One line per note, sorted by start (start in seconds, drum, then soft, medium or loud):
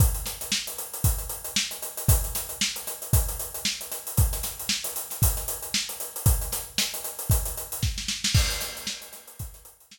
0.00 kick loud
0.00 closed hi-hat loud
0.14 closed hi-hat medium
0.26 snare medium
0.26 closed hi-hat medium
0.41 snare soft
0.41 closed hi-hat medium
0.52 snare loud
0.67 closed hi-hat medium
0.78 closed hi-hat medium
0.94 closed hi-hat medium
1.04 kick medium
1.04 closed hi-hat loud
1.18 closed hi-hat medium
1.29 closed hi-hat medium
1.44 closed hi-hat medium
1.56 snare loud
1.71 closed hi-hat medium
1.82 closed hi-hat medium
1.97 closed hi-hat medium
2.08 kick loud
2.08 closed hi-hat loud
2.24 closed hi-hat medium
2.35 snare medium
2.35 closed hi-hat medium
2.49 closed hi-hat medium
2.61 snare loud
2.76 closed hi-hat medium
2.87 snare soft
2.87 closed hi-hat medium
3.02 closed hi-hat medium
3.13 kick loud
3.13 closed hi-hat loud
3.28 closed hi-hat medium
3.39 closed hi-hat medium
3.54 closed hi-hat medium
3.65 snare loud
3.81 closed hi-hat medium
3.92 snare soft
3.92 closed hi-hat medium
4.07 closed hi-hat medium
4.17 kick loud
4.17 closed hi-hat loud
4.33 snare soft
4.33 closed hi-hat medium
4.43 snare medium
4.43 closed hi-hat medium
4.59 closed hi-hat medium
4.69 snare loud
4.84 closed hi-hat medium
4.96 closed hi-hat medium
5.10 snare soft
5.10 closed hi-hat medium
5.22 kick medium
5.22 closed hi-hat loud
5.37 snare soft
5.37 closed hi-hat medium
5.48 closed hi-hat medium
5.62 closed hi-hat medium
5.74 snare loud
5.89 closed hi-hat medium
6.00 closed hi-hat medium
6.16 closed hi-hat medium
6.26 kick loud
6.26 closed hi-hat loud
6.41 closed hi-hat medium
6.52 snare medium
6.52 closed hi-hat medium
6.78 snare loud
6.78 closed hi-hat medium
6.94 closed hi-hat medium
7.04 closed hi-hat medium
7.19 closed hi-hat medium
7.30 kick medium
7.30 closed hi-hat loud
7.45 closed hi-hat medium
7.57 closed hi-hat medium
7.72 closed hi-hat medium
7.83 kick medium
7.83 snare medium
7.98 snare medium
8.08 snare medium
8.24 snare loud
8.34 kick loud
8.34 crash loud
8.50 closed hi-hat medium
8.61 snare medium
8.61 closed hi-hat medium
8.77 closed hi-hat medium
8.87 snare loud
9.02 closed hi-hat medium
9.13 snare soft
9.13 closed hi-hat medium
9.27 closed hi-hat medium
9.39 kick medium
9.39 closed hi-hat medium
9.54 snare soft
9.54 closed hi-hat medium
9.65 closed hi-hat medium
9.80 closed hi-hat medium
9.91 snare loud